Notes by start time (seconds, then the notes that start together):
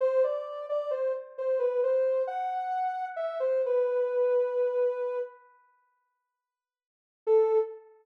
0.01 C5
0.24 D5
0.69 D5
0.91 C5
1.38 C5
1.59 B4
1.83 C5
2.27 F#5
3.16 E5
3.40 C5
3.66 B4
7.27 A4